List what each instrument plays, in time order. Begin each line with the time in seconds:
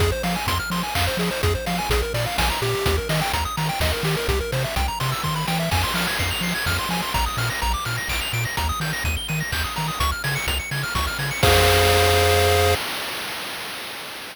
0.00 synth bass 1 F2, lead 1 (square) G#4, kick, closed hi-hat
0.12 lead 1 (square) C5
0.23 synth bass 1 F3, lead 1 (square) F5, open hi-hat
0.36 lead 1 (square) G#5
0.47 synth bass 1 F2, lead 1 (square) C6, kick, closed hi-hat
0.60 lead 1 (square) F6
0.70 synth bass 1 F3, lead 1 (square) C6, open hi-hat
0.83 lead 1 (square) G#5
0.95 synth bass 1 F2, lead 1 (square) F5, kick, clap
1.07 lead 1 (square) C5
1.17 synth bass 1 F3, lead 1 (square) G#4, open hi-hat
1.31 lead 1 (square) C5
1.43 synth bass 1 F2, lead 1 (square) G#4, kick, closed hi-hat
1.55 lead 1 (square) C5
1.66 synth bass 1 F3, lead 1 (square) F5, open hi-hat
1.79 lead 1 (square) G#5
1.90 synth bass 1 A#1, lead 1 (square) G#4, kick, closed hi-hat
2.02 lead 1 (square) A#4
2.14 synth bass 1 A#2, lead 1 (square) D5, open hi-hat
2.26 lead 1 (square) F5
2.38 synth bass 1 A#1, lead 1 (square) G#5, kick, snare
2.50 lead 1 (square) A#5
2.62 synth bass 1 A#2, lead 1 (square) G4, open hi-hat
2.86 synth bass 1 D#2, kick, closed hi-hat
2.98 lead 1 (square) A#4
3.09 synth bass 1 D#3, lead 1 (square) D#5, open hi-hat
3.21 lead 1 (square) G5
3.33 synth bass 1 D#2, lead 1 (square) A#5, kick, closed hi-hat
3.45 lead 1 (square) D#6
3.57 synth bass 1 D#3, lead 1 (square) A#5, open hi-hat
3.69 lead 1 (square) G5
3.80 synth bass 1 D#2, lead 1 (square) D#5, kick, snare
3.93 lead 1 (square) A#4
4.03 synth bass 1 D#3, lead 1 (square) G4, open hi-hat
4.17 lead 1 (square) A#4
4.28 synth bass 1 C2, lead 1 (square) G4, kick, closed hi-hat
4.40 lead 1 (square) A#4
4.52 synth bass 1 C3, lead 1 (square) C5, open hi-hat
4.64 lead 1 (square) E5
4.76 synth bass 1 C2, lead 1 (square) G5, kick, closed hi-hat
4.88 lead 1 (square) A#5
5.00 synth bass 1 C3, lead 1 (square) C6, open hi-hat
5.12 lead 1 (square) E6
5.24 synth bass 1 D#3, lead 1 (square) C6, kick
5.36 lead 1 (square) B5
5.48 synth bass 1 E3, lead 1 (square) G5, snare
5.60 lead 1 (square) E5
5.71 synth bass 1 F2, lead 1 (square) G#5, kick, crash
5.83 lead 1 (square) C6
5.94 synth bass 1 F3, lead 1 (square) F6, open hi-hat
6.07 lead 1 (square) G#6
6.19 synth bass 1 F2, lead 1 (square) C7, kick, closed hi-hat
6.31 lead 1 (square) F7
6.41 synth bass 1 F3, lead 1 (square) C7, open hi-hat
6.55 lead 1 (square) G#6
6.66 synth bass 1 F2, lead 1 (square) F6, kick, snare
6.79 lead 1 (square) C6
6.89 synth bass 1 F3, lead 1 (square) G#5, open hi-hat
7.02 lead 1 (square) C6
7.14 synth bass 1 A#1, lead 1 (square) A#5, kick, closed hi-hat
7.26 lead 1 (square) D#6
7.37 synth bass 1 A#2, lead 1 (square) F6, open hi-hat
7.50 lead 1 (square) A#6
7.62 synth bass 1 A#1, lead 1 (square) A#5, kick, closed hi-hat
7.74 lead 1 (square) D6
7.85 synth bass 1 A#2, lead 1 (square) F6, open hi-hat
7.98 lead 1 (square) A#6
8.08 synth bass 1 A#1, lead 1 (square) D7, kick, clap
8.21 lead 1 (square) F7
8.33 synth bass 1 A#2, lead 1 (square) D7, open hi-hat
8.45 lead 1 (square) A#6
8.57 synth bass 1 D#2, lead 1 (square) A#5, kick, closed hi-hat
8.69 lead 1 (square) D#6
8.80 synth bass 1 D#3, lead 1 (square) G6, open hi-hat
8.93 lead 1 (square) A#6
9.04 synth bass 1 D#2, lead 1 (square) D#7, kick, closed hi-hat
9.17 lead 1 (square) G7
9.28 synth bass 1 D#3, lead 1 (square) D#7, open hi-hat
9.40 lead 1 (square) A#6
9.52 synth bass 1 D#2, lead 1 (square) G6, kick, clap
9.64 lead 1 (square) D#6
9.76 synth bass 1 D#3, lead 1 (square) A#5, open hi-hat
9.88 lead 1 (square) D#6
10.00 synth bass 1 C#2, lead 1 (square) C#6, kick, closed hi-hat
10.12 lead 1 (square) F6
10.24 synth bass 1 C#3, lead 1 (square) G#6, open hi-hat
10.36 lead 1 (square) C#7
10.47 synth bass 1 C#2, lead 1 (square) F7, kick, closed hi-hat
10.60 lead 1 (square) C#7
10.71 synth bass 1 C#3, lead 1 (square) G#6, open hi-hat
10.83 lead 1 (square) F6
10.95 synth bass 1 C#2, lead 1 (square) C#6, kick, snare
11.07 lead 1 (square) F6
11.19 synth bass 1 C#3, lead 1 (square) G#6, open hi-hat
11.31 lead 1 (square) C#7
11.43 synth bass 1 F2, lead 1 (square) G#4 C5 F5, kick, crash